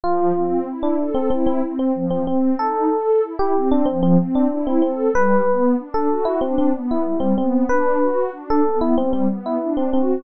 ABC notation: X:1
M:4/4
L:1/16
Q:1/4=94
K:Am
V:1 name="Electric Piano 1"
F4 z D2 C C C z C2 C C2 | A4 z G2 D C C z D2 C C2 | B4 z A2 E C C z E2 C C2 | B4 z A2 E C C z E2 C C2 |]
V:2 name="Pad 2 (warm)"
F,2 C2 E2 A2 E2 C2 F,2 C2 | _E2 A2 =E2 C2 F,2 C2 E2 A2 | G,2 B,2 D2 ^F2 D2 B,2 G,2 B,2 | D2 ^F2 D2 B,2 G,2 B,2 D2 F2 |]